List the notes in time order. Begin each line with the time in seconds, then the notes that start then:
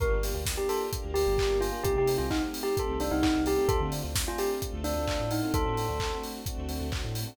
0.00 G1 A#3 D4 F4 G4 A#4, kick, closed hi-hat
0.11 G1
0.23 A#3 D4 F4 G4, open hi-hat
0.34 D2 A#3 D4 F4 G4
0.46 A#3 D4 F4 G4, kick, snare
0.57 A#3 D4 F4 G4
0.69 A4, open hi-hat
0.92 A#3 D4 F4 G4 A#4, kick, closed hi-hat
1.04 D2
1.14 A#3 D4 F4 G4, open hi-hat
1.27 G1
1.38 A#3 D4 F4 G4, kick, clap
1.50 G1
1.61 F4, open hi-hat
1.72 A#3 D4 F4 G4
1.83 C2 A3 C4 D#4 G4, kick, closed hi-hat
1.96 C3 G4
2.07 A3 C4 D#4 G4, open hi-hat
2.18 C2 A3 C4 D#4 F4 G4
2.30 A3 C4 D#4 G4, kick, clap
2.42 A3 C4 D#4 G4
2.54 open hi-hat
2.63 G4
2.77 A3 C4 D#4 G4 A4, kick, closed hi-hat
2.89 C2
3.00 A3 C4 D4 D#4 G4, open hi-hat
3.11 C2 D#4
3.22 A3 C4 D#4 G4, kick, clap
3.35 C2
3.46 G4, open hi-hat
3.57 A3 C4 D#4 G4
3.68 D2 A3 C4 D4 F4 A4, kick, closed hi-hat
3.81 D3
3.92 A3 C4 D4 F4, open hi-hat
4.03 D2 A3 C4 D4 F4
4.15 A3 C4 D4 F4, kick, snare
4.27 A3 C4 D4 F4
4.38 G4, open hi-hat
4.62 A3 C4 D4 F4 A4, kick, closed hi-hat
4.73 D2
4.84 A3 C4 D4 F4, open hi-hat
4.96 D2
5.07 A3 C4 D4 F4, kick, clap
5.20 A2
5.31 D#4, open hi-hat
5.42 A3 C4 D4 F4
5.54 D2 A3 C4 D4 F#4 A4, kick, closed hi-hat
5.65 A2
5.77 A3 C4 D4 F#4, open hi-hat
5.88 D2 A3 C4 D4 F#4
6.00 A3 C4 D4 F#4, kick, clap
6.13 A3 C4 D4 F#4
6.23 open hi-hat
6.46 A3 C4 D4 F#4 A4, kick, closed hi-hat
6.58 D2
6.69 A3 C4 D4 F#4, open hi-hat
6.81 D2
6.92 A3 C4 D4 F#4, kick, clap
7.04 A2
7.15 open hi-hat
7.27 A3 C4 D4 F#4